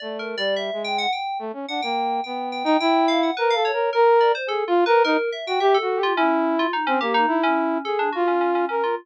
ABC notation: X:1
M:4/4
L:1/16
Q:1/4=107
K:none
V:1 name="Flute"
(3A,4 G,4 ^G,4 z2 A, ^C D ^A,3 | B,3 ^D E4 (3^A2 =A2 ^A2 A3 z | (3^G2 F2 ^A2 ^D z2 ^F (3=G2 F2 G2 E4 | z C ^A,2 E4 ^G2 F4 ^A2 |]
V:2 name="Electric Piano 2"
(3d2 ^A2 d2 e2 g ^f g2 z2 f g3 | g2 g g g2 f ^f B =f ^c2 ^A2 d =c | (3A2 F2 B2 ^A2 e g e =A2 F ^C3 F | ^D ^C G D2 C3 A =D ^F C C C C =F |]